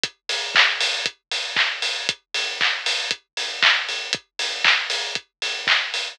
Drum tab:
HH |xo-oxo-o|xo-oxo-o|xo-oxo-o|
CP |--x---x-|--x---x-|--x---x-|
BD |o-o-o-o-|o-o-o-o-|o-o-o-o-|